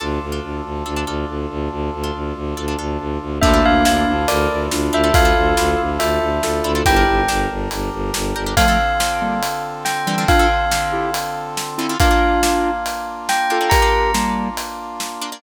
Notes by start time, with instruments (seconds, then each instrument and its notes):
0.00 violin D2, orchestral harp D4 F4 A4, brass section D4 F4 A4
0.22 violin D2
0.32 orchestral harp D4 F4 A4
0.43 violin D2
0.64 violin D2
0.86 violin D2, orchestral harp D4 F4 A4
0.96 orchestral harp D4 F4 A4
1.07 violin D2, orchestral harp D4 F4 A4
1.28 violin D2
1.50 violin D2
1.71 violin D2
1.93 violin D2
2.04 orchestral harp D4 F4 A4
2.14 violin D2
2.35 violin D2
2.57 violin D2, orchestral harp D4 F4 A4
2.68 orchestral harp D4 F4 A4
2.79 violin D2, orchestral harp D4 F4 A4
3.00 violin D2
3.21 violin D2
3.41 violin D2, lead 1 (square) A#3 D4, brass section D4 E4 F4 A4, orchestral harp D4 E4 F4 A4, tubular bells E5, kick, crash
3.54 orchestral harp D4 E4 F4 A4
3.65 violin D2, tubular bells F5
3.85 violin D2, orchestral harp D4 E4 F4 A4, tubular bells F5, snare
4.07 violin D2
4.28 violin D2, lead 1 (square) A#4 D5, tubular bells D5, closed hi-hat
4.50 violin D2
4.71 violin D2, lead 1 (square) D4 F4, snare
4.93 violin D2, orchestral harp D4 E4 F4 A4, tubular bells E5
5.04 orchestral harp D4 E4 F4 A4
5.13 violin D2, lead 1 (square) F4 A4, tubular bells F5, kick, closed hi-hat
5.25 orchestral harp D4 E4 F4 A4
5.36 violin D2
5.57 violin D2, orchestral harp D4 E4 F4 A4, snare
5.79 violin D2
6.00 violin D2, lead 1 (square) F4 A4, tubular bells E5, closed hi-hat
6.21 violin D2
6.43 violin D2, lead 1 (square) F4 A4, snare
6.64 violin D2, orchestral harp D4 E4 F4 A4
6.75 orchestral harp D4 E4 F4 A4
6.85 violin G1, brass section D4 G4 A#4, orchestral harp D4 G4 A#4, lead 1 (square) E4 G4, tubular bells G5, kick, closed hi-hat
6.96 orchestral harp D4 G4 A#4
7.07 violin G1
7.28 violin G1, orchestral harp D4 G4 A#4, snare
7.50 violin G1
7.71 violin G1, closed hi-hat
7.92 violin G1
8.14 violin G1, snare
8.35 violin G1, orchestral harp D4 G4 A#4
8.46 orchestral harp D4 G4 A#4
8.56 brass section D3 C4 F4 A4, orchestral harp D3 C4 F4 A4, lead 1 (square) F3 A3, tubular bells F5, kick, closed hi-hat
8.68 orchestral harp D3 C4 F4 A4
9.00 orchestral harp D3 C4 F4 A4, snare
9.22 lead 1 (square) G3 A#3
9.43 closed hi-hat
9.85 tubular bells G5, snare
10.07 orchestral harp D3 C4 F4 A4, lead 1 (square) E3 G3
10.18 orchestral harp D3 C4 F4 A4
10.28 lead 1 (square) D4 F4, tubular bells F5, kick, closed hi-hat
10.39 orchestral harp D3 C4 F4 A4
10.71 orchestral harp D3 C4 F4 A4, snare
10.92 lead 1 (square) E4 G4
11.14 closed hi-hat
11.57 snare
11.78 orchestral harp D3 C4 F4 A4, lead 1 (square) C4 E4
11.89 orchestral harp D3 C4 F4 A4
12.00 orchestral harp A#3 D4 F4, brass section A#3 D4 F4, lead 1 (square) D4 F4, tubular bells F5, kick, closed hi-hat
12.11 orchestral harp A#3 D4 F4
12.43 orchestral harp A#3 D4 F4, snare
12.86 closed hi-hat
13.29 tubular bells G5, snare
13.50 orchestral harp A#3 D4 F4, lead 1 (square) F4 A4
13.61 orchestral harp A#3 D4 F4
13.70 lead 1 (square) G4 A#4, tubular bells A#5, kick, closed hi-hat
13.82 orchestral harp A#3 D4 F4
14.14 lead 1 (square) G3 A#3, orchestral harp A#3 D4 F4, snare
14.57 closed hi-hat
15.00 snare
15.22 orchestral harp A#3 D4 F4
15.32 orchestral harp A#3 D4 F4